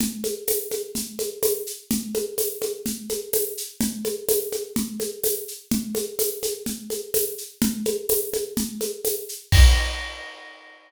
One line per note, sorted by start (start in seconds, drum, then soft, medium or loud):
0.00 low conga loud
0.00 shaker medium
0.24 high conga medium
0.24 shaker medium
0.47 tambourine medium
0.47 high conga medium
0.47 shaker medium
0.71 high conga medium
0.71 shaker medium
0.95 low conga medium
0.95 shaker medium
1.19 high conga medium
1.19 shaker medium
1.43 tambourine medium
1.43 high conga loud
1.43 shaker medium
1.66 shaker medium
1.90 low conga loud
1.90 shaker medium
2.14 high conga medium
2.14 shaker medium
2.38 tambourine medium
2.38 high conga medium
2.38 shaker medium
2.62 high conga medium
2.62 shaker medium
2.86 low conga medium
2.86 shaker medium
3.09 high conga medium
3.09 shaker medium
3.33 tambourine medium
3.33 high conga medium
3.33 shaker medium
3.57 shaker medium
3.81 low conga loud
3.81 shaker medium
4.05 high conga medium
4.05 shaker medium
4.29 tambourine medium
4.29 high conga loud
4.29 shaker medium
4.52 high conga medium
4.52 shaker medium
4.76 low conga loud
4.76 shaker medium
5.00 high conga medium
5.00 shaker medium
5.24 tambourine medium
5.24 high conga medium
5.24 shaker medium
5.48 shaker medium
5.71 low conga loud
5.71 shaker medium
5.95 high conga medium
5.95 shaker medium
6.19 tambourine medium
6.19 high conga medium
6.19 shaker medium
6.43 high conga medium
6.43 shaker medium
6.66 low conga medium
6.66 shaker medium
6.90 high conga medium
6.90 shaker medium
7.14 tambourine medium
7.14 high conga medium
7.14 shaker medium
7.38 shaker medium
7.62 low conga loud
7.62 shaker medium
7.85 high conga medium
7.85 shaker medium
8.09 tambourine medium
8.09 high conga medium
8.09 shaker medium
8.33 high conga medium
8.33 shaker medium
8.57 low conga loud
8.57 shaker medium
8.81 high conga medium
8.81 shaker medium
9.05 tambourine medium
9.05 high conga medium
9.05 shaker medium
9.29 shaker medium
9.52 kick loud
9.52 crash loud